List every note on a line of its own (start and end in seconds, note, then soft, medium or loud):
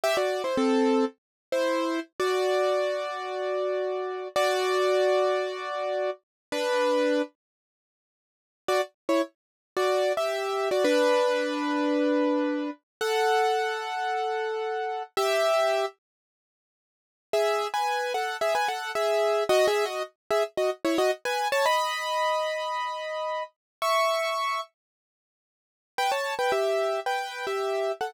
0.04 0.16 G4 medium
0.04 0.16 E5 medium
0.17 0.42 F#4 medium
0.17 0.42 D5 medium
0.44 0.57 E4 medium
0.44 0.57 C5 medium
0.57 1.05 C4 medium
0.57 1.05 A4 medium
1.52 2.00 E4 medium
1.52 2.00 C5 medium
2.20 4.28 F#4 medium
2.20 4.28 D5 medium
4.36 6.10 F#4 medium
4.36 6.10 D5 medium
6.52 7.22 D4 medium
6.52 7.22 B4 medium
8.68 8.81 F#4 medium
8.68 8.81 D5 medium
9.09 9.22 E4 medium
9.09 9.22 C#5 medium
9.77 10.13 F#4 medium
9.77 10.13 D5 medium
10.17 10.69 G4 medium
10.17 10.69 E5 medium
10.71 10.84 F#4 medium
10.71 10.84 D5 medium
10.84 12.70 D4 medium
10.84 12.70 B4 medium
13.01 15.03 A4 medium
13.01 15.03 F#5 medium
15.17 15.85 G4 medium
15.17 15.85 E5 medium
17.33 17.67 G#4 medium
17.33 17.67 E5 medium
17.74 18.13 B4 medium
17.74 18.13 G#5 medium
18.14 18.37 A4 medium
18.14 18.37 F#5 medium
18.41 18.54 G#4 medium
18.41 18.54 E5 medium
18.55 18.68 B4 medium
18.55 18.68 G#5 medium
18.68 18.91 A4 medium
18.68 18.91 F#5 medium
18.95 19.44 G#4 medium
18.95 19.44 E5 medium
19.49 19.66 F#4 medium
19.49 19.66 D#5 medium
19.67 19.85 G#4 medium
19.67 19.85 E5 medium
19.85 20.03 F#4 medium
19.85 20.03 D#5 medium
20.31 20.43 G#4 medium
20.31 20.43 E5 medium
20.57 20.70 F#4 medium
20.57 20.70 D#5 medium
20.85 20.97 E4 medium
20.85 20.97 C#5 medium
20.98 21.11 F#4 medium
20.98 21.11 D#5 medium
21.25 21.48 B4 medium
21.25 21.48 G#5 medium
21.52 21.65 C#5 medium
21.52 21.65 A5 medium
21.66 23.43 D#5 medium
21.66 23.43 B5 medium
23.82 24.61 E5 medium
23.82 24.61 C#6 medium
25.98 26.11 B4 medium
25.98 26.11 G5 medium
26.12 26.34 C#5 medium
26.12 26.34 A5 medium
26.39 26.52 B4 medium
26.39 26.52 G5 medium
26.52 27.00 G4 medium
26.52 27.00 E5 medium
27.06 27.45 B4 medium
27.06 27.45 G5 medium
27.47 27.92 G4 medium
27.47 27.92 E5 medium
28.01 28.14 A4 medium
28.01 28.14 F#5 medium